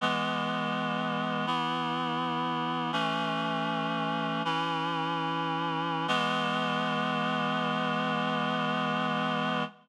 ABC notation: X:1
M:4/4
L:1/8
Q:1/4=82
K:E
V:1 name="Clarinet"
[E,G,B,]4 [E,B,E]4 | "^rit." [E,A,C]4 [E,CE]4 | [E,G,B,]8 |]